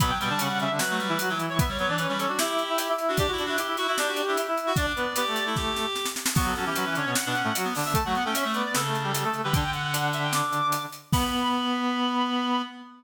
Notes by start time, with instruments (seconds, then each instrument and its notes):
0.00 clarinet B2 F#3 B3 B5, kick, closed hi-hat
0.10 clarinet G5
0.20 clarinet B2 G3 B3 G5, closed hi-hat
0.30 clarinet D3 D4 A5
0.39 clarinet C#3 C#4 F#5, closed hi-hat
0.49 clarinet C#3 C#4
0.59 clarinet C#3 C#4 E5, closed hi-hat
0.70 clarinet D3 D4 E5
0.79 clarinet F#3 F#4 B4, snare
0.90 clarinet A3
0.99 clarinet G3, closed hi-hat
1.08 clarinet E3 E4
1.19 clarinet F#3 F#4, closed hi-hat
1.29 clarinet E3 F#3 E4
1.39 closed hi-hat
1.49 clarinet C#5
1.59 clarinet B3 B4 E5, kick, closed hi-hat
1.68 clarinet G3 C#5
1.79 clarinet F#3 B3 B4 C#5, closed hi-hat
1.88 clarinet E3 D4 D5
1.98 clarinet C#4 B4 C#5, closed hi-hat
2.09 clarinet G3 C#4 C#5
2.18 clarinet C#4 A4 C#5, closed hi-hat
2.28 clarinet D4 F#4 D5
2.38 clarinet E4 G4 E5, snare
2.58 closed hi-hat
2.69 clarinet E4 E5
2.78 clarinet E4 E5, closed hi-hat
2.89 clarinet E4 E5
2.98 closed hi-hat
3.08 clarinet D4 F#4
3.17 clarinet D4 G4 D5, kick, closed hi-hat
3.28 clarinet F#4
3.32 clarinet E4
3.38 clarinet D4 F#4 D5, closed hi-hat
3.45 clarinet D4 E4 F#4 E5
3.57 clarinet E4 G4 E5, closed hi-hat
3.67 clarinet E4 E5
3.77 clarinet E4 F#4 E5, closed hi-hat
3.87 clarinet E4 F#4 E5
3.97 clarinet D4 G4 D5, snare
4.08 clarinet F#4
4.16 closed hi-hat
4.27 clarinet D4 E4 E5
4.37 clarinet E4 E5, closed hi-hat
4.47 clarinet E4 E5
4.57 closed hi-hat
4.67 clarinet F#4
4.76 clarinet D4 D5, kick, closed hi-hat
4.96 clarinet B3 B4, closed hi-hat
5.16 clarinet B3 G4 B4, closed hi-hat
5.27 clarinet A3 A4
5.36 closed hi-hat
5.46 clarinet E4
5.56 clarinet G4, kick, snare
5.76 snare
5.95 snare
6.05 snare
6.16 snare
6.26 snare
6.35 clarinet F#3 B3 F#4, kick, crash
6.46 clarinet A4
6.55 clarinet F#3 C#4 F#4 A4, closed hi-hat
6.66 clarinet E3 E4 G4
6.75 clarinet F#3 F#4 B4, closed hi-hat
6.86 clarinet E3 E4
6.95 clarinet D3 D4 C#5, closed hi-hat
7.05 clarinet B2 B3 C#5
7.15 clarinet F#5, snare
7.26 clarinet B2 B3 D4
7.35 clarinet C#4, closed hi-hat
7.44 clarinet A2 A3
7.55 clarinet F#3 F#4, closed hi-hat
7.64 clarinet B3
7.75 clarinet D3 D4, open hi-hat
7.85 clarinet E5
7.94 clarinet A3 A4 A5, kick, closed hi-hat
8.05 clarinet F#3 A3 F#4 F#5
8.15 clarinet B3 F#5, closed hi-hat
8.24 clarinet A3 C#4 A4 G5
8.34 clarinet C#4 C#5 E5, closed hi-hat
8.45 clarinet A3
8.54 clarinet B3 B4 D5, closed hi-hat
8.64 clarinet D5
8.74 clarinet C#3 A4, snare
8.85 clarinet A3 A4
8.95 closed hi-hat
9.03 clarinet G3 G4
9.14 clarinet G3 G4, closed hi-hat
9.24 clarinet A3 A4
9.34 closed hi-hat
9.44 clarinet D3 G3 G4 B4
9.53 clarinet D3 D4 G5, kick, closed hi-hat
9.73 clarinet F#5, closed hi-hat
9.83 clarinet F#5
9.93 clarinet D3 D4, closed hi-hat
10.13 clarinet E5, closed hi-hat
10.23 clarinet G5
10.33 clarinet D6, snare
10.52 closed hi-hat
10.72 closed hi-hat
10.92 closed hi-hat
11.12 clarinet B3 B5, kick, crash